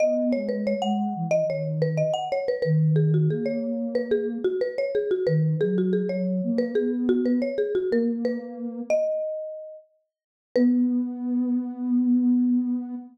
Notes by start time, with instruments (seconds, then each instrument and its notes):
0.00 ocarina B3, marimba D#5
0.32 ocarina G#3, marimba C#5
0.49 marimba B4
0.67 marimba C#5
0.82 ocarina G#3, marimba F#5
1.15 ocarina E3
1.31 marimba D#5
1.48 ocarina D#3, marimba C#5
1.82 marimba B4
1.97 marimba D#5
2.14 marimba F#5
2.32 marimba C#5
2.48 marimba B4
2.62 ocarina D#3, marimba B4
2.96 marimba G#4
3.14 marimba F#4
3.29 ocarina A#3, marimba G#4
3.46 marimba C#5
3.95 marimba B4
4.11 marimba G#4
4.44 marimba F#4
4.61 marimba B4
4.78 marimba C#5
4.95 marimba G#4
5.11 marimba F#4
5.27 ocarina D#3, marimba B4
5.61 ocarina F#3, marimba G#4
5.78 marimba F#4
5.93 marimba G#4
6.09 ocarina F#3, marimba C#5
6.43 ocarina A#3
6.58 marimba B4
6.75 ocarina B3, marimba G#4
7.09 marimba F#4
7.26 marimba B4
7.42 marimba C#5
7.58 marimba G#4
7.75 marimba F#4
7.91 ocarina A#3, marimba A#4
8.25 marimba B4
8.90 marimba D#5
10.56 ocarina B3, marimba B4